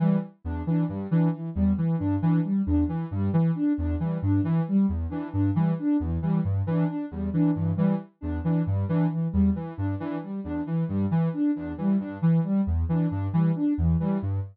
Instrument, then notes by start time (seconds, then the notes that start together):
ocarina
0.00 E3 G3
0.44 E2 D4
0.67 E3 D4
0.89 G2 G3
1.10 E3 D4
1.32 E3
1.55 E2 G3
1.78 E3
1.98 G2 D4
2.22 E3 D4
2.44 G3
2.66 E2 D4
2.87 E3
3.11 G2 G3
3.33 E3
3.55 D4
3.78 E2 D4
4.00 E3 G3
4.22 G2 D4
4.42 E3
4.68 G3
4.89 E2
5.09 E3 D4
5.32 G2 D4
5.54 E3 G3
5.79 D4
6.00 E2 E3
6.22 E3 G3
6.44 G2
6.67 E3 D4
6.88 D4
7.11 E2 G3
7.33 E3 D4
7.54 G2 E3
7.76 E3 G3
8.21 E2 D4
8.43 E3 D4
8.67 G2 G3
8.88 E3 D4
9.10 E3
9.32 E2 G3
9.56 E3
9.77 G2 D4
9.99 E3 D4
10.22 G3
10.44 E2 D4
10.66 E3
10.88 G2 G3
11.11 E3
11.33 D4
11.55 E2 D4
11.78 E3 G3
12.00 G2 D4
12.21 E3
12.43 G3
12.67 E2
12.89 E3 D4
13.09 G2 D4
13.33 E3 G3
13.56 D4
13.78 E2 E3
14.00 E3 G3
14.22 G2